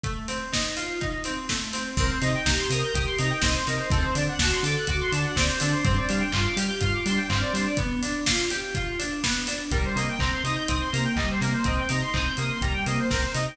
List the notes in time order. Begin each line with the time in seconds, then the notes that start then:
0.04 A3, kick, closed hi-hat
0.28 C4, open hi-hat
0.52 D#4, kick, snare
0.77 F4, open hi-hat
1.01 D#4, kick, closed hi-hat
1.24 C4, open hi-hat
1.49 A3, kick, snare
1.73 C4, snare, open hi-hat
1.97 C2 C4 A#4, kick, crash
2.11 C5
2.22 C3 D#4 D#5, open hi-hat
2.34 G5
2.45 C2 G4 A#5, kick, snare
2.57 C6
2.70 C3 A#4 D#6, open hi-hat
2.84 G6
2.93 C2 G4 D#6, kick, closed hi-hat
3.06 C6
3.18 C3 D#4 A#5, open hi-hat
3.30 G5
3.42 C2 C4 D#5, kick, snare
3.55 C5
3.67 C3 D#4 A#4, snare, open hi-hat
3.79 C5
3.90 D2 C4 A4, kick, closed hi-hat
4.02 C5
4.15 D3 D4 D5, open hi-hat
4.29 F#5
4.39 D2 F#4 A5, kick, snare
4.52 C6
4.63 D3 A4 D6, open hi-hat
4.77 F#6
4.87 D2 F#4 D6, kick, closed hi-hat
5.01 C6
5.12 D3 D4 A5, open hi-hat
5.25 F#5
5.36 D2 C4 D5, kick, snare
5.47 C5
5.60 D3 D4 A4, snare, open hi-hat
5.72 C5
5.85 G2 C4 C5, kick, closed hi-hat
5.95 D5
6.09 G3 D4 F5, open hi-hat
6.20 G5
6.32 G2 F4 C6, kick, clap
6.45 D6
6.56 G3 G4 F6, open hi-hat
6.68 G6
6.81 G2 F4 F6, kick, closed hi-hat
6.93 D6
7.06 G3 D4 C6, open hi-hat
7.16 G5
7.29 G2 C4 F5, kick, clap
7.41 D5
7.54 G3 D4 C5, snare, open hi-hat
7.66 D5
7.77 B3, kick, closed hi-hat
8.02 D4, open hi-hat
8.26 F4, kick, snare
8.51 G4, open hi-hat
8.75 F4, kick, closed hi-hat
8.99 D4, open hi-hat
9.23 B3, kick, snare
9.47 D4, snare, open hi-hat
9.71 C2 G3 A#4, kick, closed hi-hat
9.85 C5
9.96 C3 A#3 D#5, open hi-hat
10.09 G5
10.19 C2 C4 A#5, kick, clap
10.32 C6
10.44 C3 D#4 D#6, open hi-hat
10.55 G6
10.68 C2 C4 D#6, kick, closed hi-hat
10.81 C6
10.92 C3 A#3 A#5, open hi-hat
11.05 G5
11.16 C2 G3 D#5, kick, clap
11.31 C5
11.40 C3 A#3 A#4, snare, open hi-hat
11.53 C5
11.64 C2 C4 D#5, kick, closed hi-hat
11.79 G5
11.89 C3 D#4 A#5, open hi-hat
12.01 C6
12.13 C2 C4 D#6, kick, clap
12.24 G6
12.37 C3 A#3 D#6, open hi-hat
12.50 C6
12.61 C2 G3 A#5, kick, closed hi-hat
12.73 G5
12.86 C3 A#3 D#5, open hi-hat
13.00 C5
13.10 C2 C4 A#4, kick, snare
13.21 C5
13.34 C3 D#4 D#5, snare, open hi-hat
13.48 G5